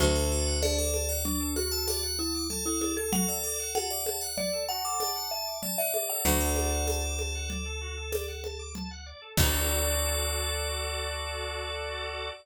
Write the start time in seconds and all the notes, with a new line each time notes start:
0.00 D2 F#4, low conga
0.15 A4
0.31 F#4 D5
0.47 F#5
0.62 D4 D5 A5, tambourine, high conga
0.78 A4 D6
0.94 A5, high conga
1.09 D5 F#5
1.25 D4 D5, low conga
1.40 A4
1.56 F#4 F#5, high conga
1.71 A4 A5
1.88 D5 F#5, tambourine, high conga
2.03 F#5
2.19 E4 A5
2.35 D6
2.50 A4 A5, low conga
2.66 E4 A4 F#5
2.81 E4 D5, high conga
2.97 A4
3.12 F#4 A4 F#5, low conga
3.28 A4 D5
3.44 A4 D5
3.60 F#5
3.75 F#4 F#5 A5, tambourine, high conga
3.90 D5 D6
4.06 A5, high conga
4.21 F#5
4.37 D5, low conga
4.53 A4
4.68 F#4 F#5 A5
4.84 A4 D6
5.00 D5 A5, tambourine, high conga
5.15 F#5
5.31 E5 A5
5.47 D6
5.63 D5 A5, low conga
5.78 D5 E5 F#5
5.94 D5 E5, high conga
6.10 A4 D5 F#5
6.25 D2 F#4 D5 F#5, low conga
6.40 A4
6.56 D5, high conga
6.72 F#5
6.87 A5, tambourine, high conga
7.03 D6
7.19 A5, high conga
7.35 F#5
7.50 D5, low conga
7.66 A4
7.81 F#4
7.97 A4
8.12 D5, tambourine, high conga
8.28 F#5
8.44 A5, high conga
8.59 D6
8.75 A5, low conga
8.91 F#5
9.06 D5
9.22 A4
9.37 D2 F#4 A4 D5, kick, crash